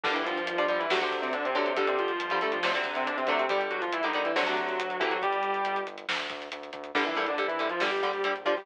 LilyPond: <<
  \new Staff \with { instrumentName = "Distortion Guitar" } { \time 4/4 \key g \dorian \tempo 4 = 139 <d d'>16 <e e'>16 <f f'>8. <f f'>16 <f f'>16 <e e'>16 <fis fis'>16 r8 <c c'>16 <d d'>16 <c c'>16 <d d'>16 <c c'>16 | <d d'>16 <c c'>16 <f f'>8. <f f'>16 <a a'>16 <f f'>16 <f f'>16 r8 <c c'>16 <d d'>16 <c c'>16 <d d'>16 <c c'>16 | <g g'>16 r16 <fis ges'>16 <f f'>16 <e e'>16 <ees dis'>8 <e e'>16 <fis fis'>4. <e e'>16 <fis fis'>16 | <g g'>4. r2 r8 |
<d d'>16 <e e'>16 <e e'>16 <d d'>16 r16 <e e'>8 <f f'>16 <g g'>4. <f f'>16 <g g'>16 | }
  \new Staff \with { instrumentName = "Overdriven Guitar" } { \time 4/4 \key g \dorian <d g>4~ <d g>16 <d g>16 <d g>8 <c d fis a>16 <c d fis a>4~ <c d fis a>16 <c d fis a>8 | <d g>4~ <d g>16 <d g>16 <d g>8 <c d fis a>16 <c d fis a>4~ <c d fis a>16 <c d fis a>8 | <d g>4~ <d g>16 <d g>16 <d g>8 <c d fis a>16 <c d fis a>4~ <c d fis a>16 <c d fis a>8 | r1 |
<d g>8 <d g>8 <d g>8 <d g>8 <d g>8 <d g>8 <d g>8 <d g>8 | }
  \new Staff \with { instrumentName = "Synth Bass 1" } { \clef bass \time 4/4 \key g \dorian g,,8 g,,8 g,,8 g,,8 d,8 d,8 d,8 d,8 | g,,8 g,,8 g,,8 g,,8 d,8 d,8 d,8 d,8 | g,,8 g,,8 g,,8 g,,8 d,8 d,8 d,8 d,8 | g,,8 g,,8 g,,8 g,,8 d,8 d,8 d,8 d,8 |
g,,8 bes,,4. g,,8 bes,,4. | }
  \new DrumStaff \with { instrumentName = "Drums" } \drummode { \time 4/4 <cymc bd>16 hh16 hh16 hh16 hh16 hh16 hh16 hh16 sn16 hh16 <hh bd>16 hh16 hh16 hh16 hh16 hh16 | <hh bd>16 hh16 hh16 hh16 hh16 hh16 hh16 hh16 sn16 hh16 <hh bd>16 hh16 hh16 hh16 <hh bd>16 hh16 | <hh bd>16 hh16 hh16 hh16 hh16 hh16 hh16 hh16 sn16 hh16 <hh bd>16 hh16 hh16 hh16 <hh bd>16 hh16 | <hh bd>16 hh16 hh16 hh16 hh16 hh16 hh16 hh16 sn16 hh16 <hh bd>16 hh16 hh16 hh16 <hh bd>16 hh16 |
<cymc bd>16 hh16 hh16 hh16 hh16 hh16 hh16 hh16 sn16 hh16 <hh bd>16 hh16 hh16 hh16 <hh bd>16 hho16 | }
>>